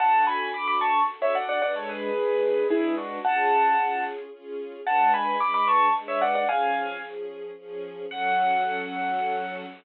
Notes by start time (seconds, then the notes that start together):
0.00 D4 F#4 A4 F#5 A5
0.27 G#5 B5
0.54 D4 F#4 A4 B5 D6
0.68 B5 D6
0.81 A5 C#6
1.09 D4 F#4 A4
1.22 C#5 E5
1.35 D5 F#5
1.49 D5 F#5
1.62 G#3 D4 B4 D5 F#5
1.76 A4 C#5
1.89 G#4 B4
2.16 G#3 D4 B4
2.70 G#3 D4 E4 G#4 B4
2.97 D4 F#4
3.25 C#4 F4 G#4 F#5 A5
3.78 C#4 F4 G#4
4.32 C#4 F4 G#4
4.86 G#3 D4 B4 F#5 A5
5.14 G#5 B5
5.39 G#3 D4 B4 B5 D6
5.54 B5 D6
5.68 A5 C#6
5.95 G#3 D4 B4
6.08 C#5 E5
6.21 D5 F#5
6.35 D5 F#5
6.48 F3 C#4 G#4 F5 G#5
7.02 F3 C#4 G#4
7.57 F3 C#4 G#4
8.10 F#3 C#4 A4 F#5